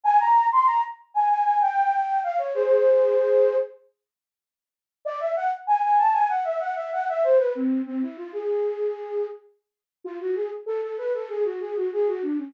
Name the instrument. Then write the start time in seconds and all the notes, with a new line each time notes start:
flute
0.04 G#5
0.20 A#5
0.52 C6
0.66 A#5
1.14 G#5
1.29 G#5
1.44 G#5
1.61 G5
2.23 F5
2.38 C#5
2.54 G#4 C5
5.05 D5
5.20 E5
5.36 F#5
5.67 G#5
5.83 G#5
5.98 A5
6.13 G#5
6.29 F#5
6.44 E5
6.60 F#5
6.76 E5
6.93 F#5
7.09 E5
7.24 C5
7.38 B4
7.55 C4
7.86 C4
8.02 E4
8.17 F4
8.33 G#4
10.04 F4
10.20 F#4
10.35 G#4
10.66 A4
10.82 A4
10.98 B4
11.14 A4
11.29 G#4
11.44 F#4
11.60 G#4
11.76 F#4
11.93 G#4
12.07 F#4
12.22 D4
12.38 C#4